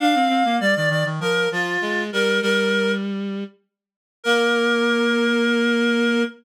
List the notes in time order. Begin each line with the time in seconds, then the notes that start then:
0.00 D4 F5
0.15 C4
0.29 C4
0.45 A#3
0.60 G3 D5
0.75 D#3 D5
0.89 D#3 D5
1.05 D#3
1.20 F3 A#4
1.52 F3 F4
1.81 G#3
2.13 G3 A#4
2.42 G3 A#4
4.23 A#3 A#4